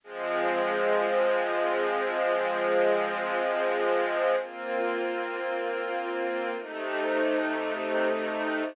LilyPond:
\new Staff { \time 4/4 \key aes \major \tempo 4 = 110 <f aes c'>1~ | <f aes c'>1 | \key bes \major <bes c' f'>1 | <c a ees'>1 | }